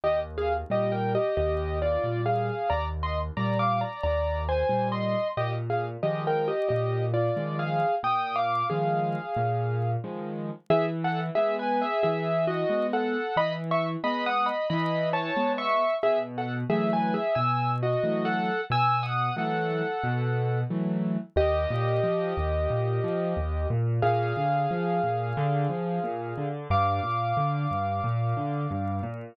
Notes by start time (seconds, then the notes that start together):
0.04 D#2 G4 D#5
0.38 G#4 F5
0.70 A#2 G3 G4 D#5
0.92 A#4 G5
1.15 G4 D#5
1.37 D#2 G4 D#5
1.82 F4 D5
2.04 A#2 G3
2.26 G#4 F5
2.70 D#2 D5 A#5
3.03 D#5 C6
3.37 A#2 G3 D5 A#5
3.59 F5 D6
3.81 D5 A#5
4.03 D#2 D5 A#5
4.49 C5 G#5
4.69 A#2 G3
4.92 D#5 C6
5.37 A#2 G4 D#5
5.70 G#4 F5
6.03 D#3 F3 G#3 G4 D#5
6.27 A#4 G5
6.48 G4 D#5
6.69 A#2 G4 D#5
7.14 F4 D5
7.37 D#3 F3 G#3
7.59 G#4 F5
8.03 A#2 G5 D#6
8.36 F5 D6
8.70 D#3 F3 G#3 G#4 F5
9.37 A#2
10.04 D#3 F3 G#3
10.70 E3 G#4 E5
11.04 A4 F#5
11.35 G#3 B3 G#4 E5
11.59 B4 G#5
11.82 G#4 E5
12.03 E3 G#4 E5
12.47 F#4 D#5
12.70 G#3 B3
12.93 A4 F#5
13.37 E3 D#5 B5
13.71 E5 C#6
14.04 G#3 B3 D#5 B5
14.26 F#5 D#6
14.46 D#5 B5
14.70 E3 D#5 B5
15.13 C#5 A5
15.36 G#3 B3
15.58 E5 C#6
16.03 B2 G#4 E5
16.38 A4 F#5
16.70 E3 F#3 A3 G#4 E5
16.93 B4 G#5
17.14 G#4 E5
17.35 B2 G#5 E6
17.83 F#4 D#5
18.03 E3 F#3 A3
18.25 A4 F#5
18.70 B2 G#5 E6
19.03 F#5 D#6
19.36 E3 F#3 A3 A4 F#5
20.03 B2
20.70 E3 F#3 A3
21.36 D#2 G4 D#5
21.70 A#2
22.03 F3
22.37 D#2
22.70 A#2
23.04 F3
23.37 D#2
23.70 A#2
24.02 A#2 G#4 F5
24.37 D3
24.71 F3
25.03 A#2
25.37 D3
25.69 F3
26.04 A#2
26.38 D3
26.70 G2 F5 D6
27.03 A#2
27.37 D3
27.71 G2
28.04 A#2
28.37 D3
28.71 G2
29.03 A#2